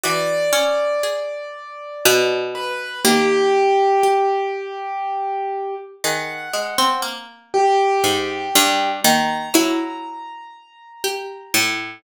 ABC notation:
X:1
M:6/8
L:1/16
Q:3/8=40
K:none
V:1 name="Harpsichord"
E,2 _D6 B,,4 | _E,8 z4 | _E,2 _A, C _B,4 _A,,2 G,,2 | _E,2 _G,6 z2 A,,2 |]
V:2 name="Acoustic Grand Piano"
d10 B2 | G12 | _g4 z2 =G6 | _b12 |]
V:3 name="Pizzicato Strings"
_G4 _A8 | _B,4 G8 | _A12 | _B,2 E6 G4 |]